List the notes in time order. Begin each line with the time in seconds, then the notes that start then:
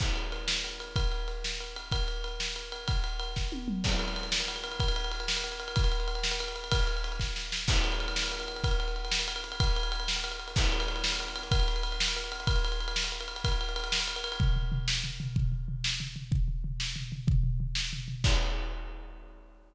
0.00 kick, crash
0.16 ride
0.32 ride
0.48 snare
0.64 ride
0.80 ride
0.96 kick, ride
1.12 ride
1.28 ride
1.44 snare
1.60 ride
1.76 ride
1.92 kick, ride
2.08 ride
2.24 ride
2.40 snare
2.56 ride
2.72 ride
2.88 kick, ride
3.04 ride
3.20 ride
3.36 kick, snare
3.52 high tom
3.68 mid tom
3.84 kick, crash
3.92 ride
3.99 ride
4.08 ride
4.16 ride
4.23 ride
4.32 snare
4.40 ride
4.48 ride
4.56 ride
4.64 ride
4.72 ride
4.80 kick, ride
4.88 ride
4.96 ride
5.04 ride
5.11 ride
5.20 ride
5.28 snare
5.37 ride
5.44 ride
5.52 ride
5.60 ride
5.68 ride
5.76 kick, ride
5.84 ride
5.92 ride
6.00 ride
6.08 ride
6.15 ride
6.23 snare
6.31 ride
6.40 ride
6.48 ride
6.56 ride
6.64 ride
6.72 kick, ride
6.80 ride
6.87 ride
6.97 ride
7.04 ride
7.12 ride
7.20 kick, snare
7.36 snare
7.52 snare
7.68 kick, crash
7.76 ride
7.84 ride
7.92 ride
8.00 ride
8.08 ride
8.16 snare
8.23 ride
8.32 ride
8.40 ride
8.48 ride
8.56 ride
8.64 kick, ride
8.71 ride
8.80 ride
8.88 ride
8.96 ride
9.05 ride
9.11 snare
9.19 ride
9.28 ride
9.36 ride
9.44 ride
9.52 ride
9.60 kick, ride
9.67 ride
9.76 ride
9.83 ride
9.92 ride
10.00 ride
10.08 snare
10.16 ride
10.24 ride
10.32 ride
10.40 ride
10.48 ride
10.56 kick, crash
10.64 ride
10.72 ride
10.80 ride
10.88 ride
10.96 ride
11.04 snare
11.12 ride
11.20 ride
11.28 ride
11.36 ride
11.43 ride
11.51 kick, ride
11.60 ride
11.68 ride
11.76 ride
11.83 ride
11.92 ride
12.00 snare
12.08 ride
12.16 ride
12.24 ride
12.32 ride
12.40 ride
12.47 kick, ride
12.56 ride
12.65 ride
12.72 ride
12.80 ride
12.88 ride
12.96 snare
13.04 ride
13.12 ride
13.21 ride
13.28 ride
13.36 ride
13.44 kick, ride
13.52 ride
13.61 ride
13.69 ride
13.76 ride
13.84 ride
13.92 snare
14.00 ride
14.08 ride
14.16 ride
14.24 ride
14.32 ride
14.40 kick, floor tom
14.56 floor tom
14.72 floor tom
14.88 snare
15.04 floor tom
15.20 floor tom
15.36 kick, floor tom
15.52 floor tom
15.68 floor tom
15.84 snare
16.00 floor tom
16.16 floor tom
16.32 kick, floor tom
16.48 floor tom
16.64 floor tom
16.80 snare
16.96 floor tom
17.12 floor tom
17.27 kick, floor tom
17.43 floor tom
17.60 floor tom
17.75 snare
17.93 floor tom
18.08 floor tom
18.24 kick, crash